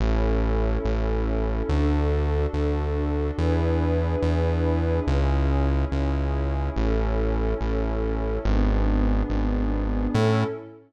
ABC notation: X:1
M:6/8
L:1/8
Q:3/8=71
K:A
V:1 name="Pad 5 (bowed)"
[CEA]6 | [DFA]6 | [DEGB]6 | [CEG]6 |
[CEA]6 | [B,DG]6 | [CEA]3 z3 |]
V:2 name="Synth Bass 1" clef=bass
A,,,3 A,,,3 | D,,3 D,,3 | E,,3 E,,3 | C,,3 C,,3 |
A,,,3 A,,,3 | G,,,3 G,,,3 | A,,3 z3 |]